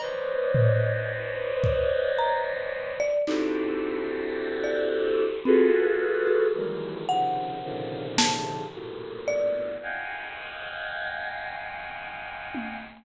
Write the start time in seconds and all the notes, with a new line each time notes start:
0.00 B4 C5 C#5 D5 D#5, cowbell
0.55 floor tom
1.64 kick
2.18 A#5
3.00 D5
3.27 C4 D4 D#4 E4 F#4 G4 A4, clap
4.64 D5
5.45 C4 F4 F#4 G#4 A4 B4
6.27 F#4
6.55 D#3 E3 F#3 G3 G#3 A#3
7.09 C3 C#3 D#3 F3 F#5
7.63 A#2 C3 C#3 D3 D#3 F3
8.18 A5, snare
8.72 G2 A2 A#2 B2
9.28 D5
9.82 D#5 F5 F#5 G5 G#5
12.55 high tom